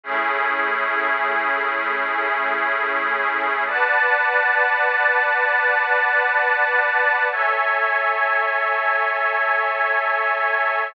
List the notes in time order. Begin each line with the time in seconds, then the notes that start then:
0.04 A3 C#4 E4 G#4
3.66 B4 D5 F#5 A5
7.31 A4 C#5 E5 G#5